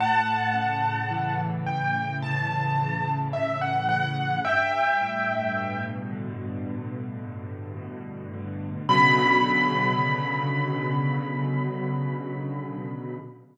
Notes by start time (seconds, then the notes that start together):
0.00 A2 F#5 A5
0.54 C#3
1.11 E3
1.66 A2 G5
2.22 C#3 A5
2.78 E3
3.33 A2 E5
3.61 F#5
3.89 C#3 F#5
4.45 G2 E5 G5
5.01 A2
5.55 B2
6.11 D3
6.66 G2
7.24 A2
7.77 B2
8.33 D3
8.89 B2 C#3 D3 F#3 B5